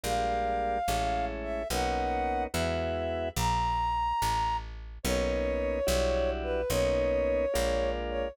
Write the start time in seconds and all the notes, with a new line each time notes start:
0.03 A#1 G3 G#3 A#3 D4 F5
0.88 A1 G#3 A3 C#4 E4
1.43 E5
1.70 B1 A#3 B3 C#4 D#4 F#5
2.54 E2 G#3 B3 E4 F#4 E5
3.36 A#1 A#5
4.22 A1
5.03 B1 A#3 B3 C#4 D#4 C#5
5.87 B1 G3 D4 E4 F#4
6.43 B4
6.70 B1 A#3 B3 C#4 D#4 C#5
7.54 A#1 G#3 A#3 D4 F4
8.09 C#5